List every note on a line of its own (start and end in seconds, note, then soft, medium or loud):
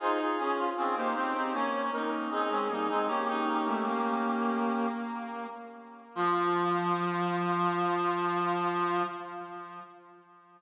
0.00 0.35 D#4 medium
0.00 0.18 F4 loud
0.00 0.18 G#4 loud
0.00 0.19 C5 loud
0.20 0.66 F4 medium
0.20 0.66 G#4 medium
0.38 0.69 C#4 medium
0.38 0.57 G#4 medium
0.57 0.75 F4 loud
0.77 0.95 C4 medium
0.77 0.95 C#4 medium
0.77 0.95 F4 medium
0.77 0.96 G#4 medium
0.96 1.14 A#3 medium
0.96 1.14 D#4 medium
0.96 1.14 G4 medium
0.96 1.14 C5 loud
1.15 1.33 C4 medium
1.15 1.34 D#4 medium
1.15 1.34 G4 medium
1.15 1.50 C5 loud
1.35 1.53 C4 medium
1.35 1.54 D#4 medium
1.35 1.54 G4 medium
1.53 1.90 A#3 medium
1.53 1.90 C#4 medium
1.53 1.92 C#4 medium
1.53 1.86 C#5 medium
1.92 2.30 A#3 medium
1.92 2.30 C#4 medium
1.92 2.28 D#4 medium
1.92 2.10 A#4 medium
2.30 2.49 C4 medium
2.30 2.49 D#4 medium
2.30 3.03 G#4 medium
2.49 2.68 G#3 medium
2.49 2.68 C4 medium
2.49 2.68 C#4 medium
2.69 2.87 G3 medium
2.69 2.87 A#3 medium
2.69 2.88 D#4 medium
2.88 3.08 G#3 medium
2.88 3.08 C4 medium
2.88 3.07 D#4 medium
3.08 4.86 A#3 medium
3.08 3.26 C#4 medium
3.08 4.86 C#4 loud
3.08 4.88 G4 loud
3.27 3.45 D#4 medium
3.46 3.64 D#4 medium
3.66 3.84 A3 medium
3.85 5.47 A#3 medium
6.15 9.03 F3 loud
6.15 9.03 F4 loud